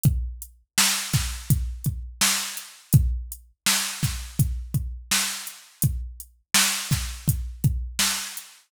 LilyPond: \new DrumStaff \drummode { \time 4/4 \tempo 4 = 83 <hh bd>8 hh8 sn8 <hh bd sn>8 <hh bd>8 <hh bd>8 sn8 hh8 | <hh bd>8 hh8 sn8 <hh bd sn>8 <hh bd>8 <hh bd>8 sn8 hh8 | <hh bd>8 hh8 sn8 <hh bd sn>8 <hh bd>8 <hh bd>8 sn8 hh8 | }